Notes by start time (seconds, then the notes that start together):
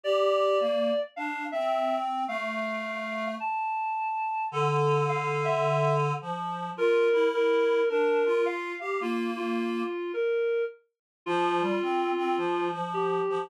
0.04 G4 D5
0.60 A#3
1.16 D4 F5
1.52 C4 E5
2.27 A3 F5
3.40 A5
4.52 D3 A4
5.09 F5
5.45 E5
6.21 F3
6.77 F4 A#4
7.13 E4
7.34 A#4
7.89 D4 A#4
8.25 F4
8.46 F5
8.80 G4 F5
9.00 A#3 F4
9.37 F4
10.13 A#4
11.26 F3 F4
11.61 G3
11.82 C4
12.17 C4
12.37 F3
12.72 F3
12.94 G4
13.30 F3